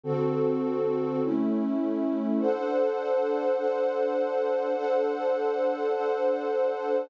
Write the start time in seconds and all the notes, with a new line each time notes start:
0.03 D3 C4 F#4 A4
1.22 A3 C#4 E4
2.40 D4 A4 C5 F#5
3.57 D4 A4 C5 F#5
4.76 D4 A4 C5 F#5
5.92 D4 A4 C5 F#5